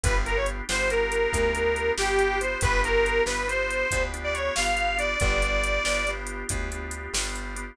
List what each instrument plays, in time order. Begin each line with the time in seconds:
0.03 electric bass (finger) G1, drawbar organ B3 D4 F4 G4, harmonica B4, kick, closed hi-hat
0.25 drawbar organ B3 D4 F4 G4, harmonica A#4, closed hi-hat
0.37 harmonica C#5
0.46 closed hi-hat
0.69 electric bass (finger) G1, drawbar organ B3 D4 F4 G4, harmonica C5, snare
0.90 drawbar organ B3 D4 F4 G4, harmonica A#4, closed hi-hat
1.12 closed hi-hat
1.32 electric bass (finger) D2, drawbar organ B3 D4 F4 G4, kick, closed hi-hat
1.55 drawbar organ B3 D4 F4 G4, closed hi-hat
1.76 closed hi-hat
1.98 electric bass (finger) G1, drawbar organ B3 D4 F4 G4, harmonica G4, snare
2.19 closed hi-hat
2.41 drawbar organ B3 D4 F4 G4, harmonica C5, closed hi-hat
2.61 electric bass (finger) G1, drawbar organ B3 D4 F4 G4, harmonica B4, kick, closed hi-hat
2.84 drawbar organ B3 D4 F4 G4, harmonica A#4, closed hi-hat
3.06 closed hi-hat
3.26 electric bass (finger) G1, drawbar organ B3 D4 F4 G4, harmonica B4, snare
3.47 drawbar organ B3 D4 F4 G4, harmonica C5, closed hi-hat
3.70 closed hi-hat
3.91 electric bass (finger) D2, drawbar organ B3 D4 F4 G4, kick, closed hi-hat
4.14 drawbar organ B3 D4 F4 G4, closed hi-hat
4.24 harmonica D5
4.34 harmonica C#5, closed hi-hat
4.55 electric bass (finger) G1, drawbar organ B3 D4 F4 G4, harmonica F5, snare
4.77 closed hi-hat
4.97 drawbar organ B3 D4 F4 G4, harmonica D5, closed hi-hat
5.20 electric bass (finger) G1, drawbar organ B3 D4 F4 G4, harmonica D5, kick, closed hi-hat
5.42 drawbar organ B3 D4 F4 G4, closed hi-hat
5.64 closed hi-hat
5.84 electric bass (finger) G1, drawbar organ B3 D4 F4 G4, snare
6.07 drawbar organ B3 D4 F4 G4, closed hi-hat
6.27 closed hi-hat
6.49 electric bass (finger) D2, drawbar organ B3 D4 F4 G4, kick, closed hi-hat
6.72 drawbar organ B3 D4 F4 G4, closed hi-hat
6.91 closed hi-hat
7.14 electric bass (finger) G1, drawbar organ B3 D4 F4 G4, snare
7.35 closed hi-hat
7.56 drawbar organ B3 D4 F4 G4, closed hi-hat